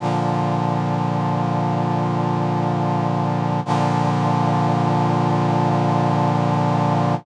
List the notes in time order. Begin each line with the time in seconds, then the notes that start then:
0.00 A#2 D3 F3
3.65 A#2 D3 F3